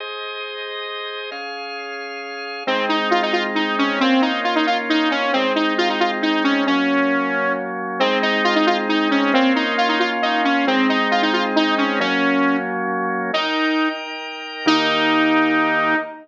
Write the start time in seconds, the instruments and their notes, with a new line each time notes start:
0.00 drawbar organ G#4 C5 D#5
1.31 drawbar organ C#4 G#4 F5
2.67 drawbar organ G#3 C4 D#4, lead 2 (sawtooth) C4
2.89 lead 2 (sawtooth) D#4
3.11 lead 2 (sawtooth) F4
3.22 lead 2 (sawtooth) D#4
3.33 lead 2 (sawtooth) F4
3.55 lead 2 (sawtooth) D#4
3.78 lead 2 (sawtooth) C#4
4.00 drawbar organ A#3 C#4 F4, lead 2 (sawtooth) C4
4.22 lead 2 (sawtooth) D#4
4.44 lead 2 (sawtooth) F4
4.56 lead 2 (sawtooth) D#4
4.67 lead 2 (sawtooth) F4
4.89 lead 2 (sawtooth) D#4
5.11 lead 2 (sawtooth) C#4
5.33 drawbar organ G#3 C4 D#4, lead 2 (sawtooth) C4
5.55 lead 2 (sawtooth) D#4
5.78 lead 2 (sawtooth) F4
5.89 lead 2 (sawtooth) D#4
6.00 lead 2 (sawtooth) F4
6.22 lead 2 (sawtooth) D#4
6.44 lead 2 (sawtooth) C#4
6.67 drawbar organ F#3 A#3 C#4, lead 2 (sawtooth) C#4
8.00 drawbar organ G#3 C4 D#4, lead 2 (sawtooth) C4
8.22 lead 2 (sawtooth) D#4
8.44 lead 2 (sawtooth) F4
8.55 lead 2 (sawtooth) D#4
8.67 lead 2 (sawtooth) F4
8.89 lead 2 (sawtooth) D#4
9.11 lead 2 (sawtooth) C#4
9.33 drawbar organ A#3 C#4 F4, lead 2 (sawtooth) C4
9.55 lead 2 (sawtooth) D#4
9.78 lead 2 (sawtooth) F4
9.89 lead 2 (sawtooth) D#4
10.00 lead 2 (sawtooth) F4
10.22 lead 2 (sawtooth) D#4
10.44 lead 2 (sawtooth) C#4
10.67 drawbar organ G#3 C4 D#4, lead 2 (sawtooth) C4
10.89 lead 2 (sawtooth) D#4
11.11 lead 2 (sawtooth) F4
11.22 lead 2 (sawtooth) D#4
11.33 lead 2 (sawtooth) F4
11.56 lead 2 (sawtooth) D#4
11.78 lead 2 (sawtooth) C#4
11.99 drawbar organ F#3 A#3 C#4, lead 2 (sawtooth) C#4
13.33 lead 2 (sawtooth) D#4, drawbar organ D#4 A#4 G5
14.66 drawbar organ D#3 A#3 G4, lead 2 (sawtooth) D#4